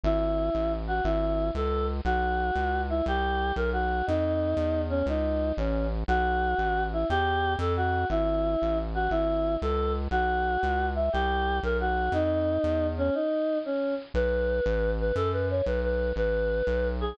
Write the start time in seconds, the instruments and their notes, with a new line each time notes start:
0.04 synth bass 1 G#1, choir aahs E4
0.55 synth bass 1 A1
0.87 choir aahs F#4
1.04 synth bass 1 G#1, choir aahs E4
1.55 synth bass 1 C#2, choir aahs A4
2.05 synth bass 1 B1, choir aahs F#4
2.55 synth bass 1 C#2
2.89 choir aahs E4
3.06 synth bass 1 C2, choir aahs G4
3.56 synth bass 1 B1, choir aahs A#4
3.73 choir aahs F#4
4.07 synth bass 1 F2, choir aahs D#4
4.57 synth bass 1 E2
4.90 choir aahs C#4
5.06 synth bass 1 C#2, choir aahs D#4
5.57 synth bass 1 A1, choir aahs C#4
6.08 synth bass 1 B1, choir aahs F#4
6.58 synth bass 1 A1
6.93 choir aahs E4
7.10 synth bass 1 E2, choir aahs G4
7.59 synth bass 1 F2, choir aahs A4
7.77 choir aahs F#4
8.10 synth bass 1 G#1, choir aahs E4
8.62 synth bass 1 A1
8.95 choir aahs F#4
9.11 synth bass 1 G#1, choir aahs E4
9.62 synth bass 1 C#2, choir aahs A4
10.11 synth bass 1 B1, choir aahs F#4
10.63 synth bass 1 C#2
10.95 choir aahs E5
11.13 synth bass 1 C2, choir aahs G4
11.63 synth bass 1 B1, choir aahs A#4
11.80 choir aahs F#4
12.12 synth bass 1 F2, choir aahs D#4
12.64 synth bass 1 E2
12.98 choir aahs C#4
13.15 choir aahs D#4
13.65 choir aahs C#4
14.14 synth bass 1 B1, choir aahs B4
14.66 synth bass 1 A1
15.00 choir aahs B4
15.15 synth bass 1 F#2, choir aahs A4
15.33 choir aahs B4
15.50 choir aahs C#5
15.66 synth bass 1 B1, choir aahs B4
15.84 choir aahs B4
16.16 synth bass 1 A1, choir aahs B4
16.67 synth bass 1 B1
17.00 choir aahs G#4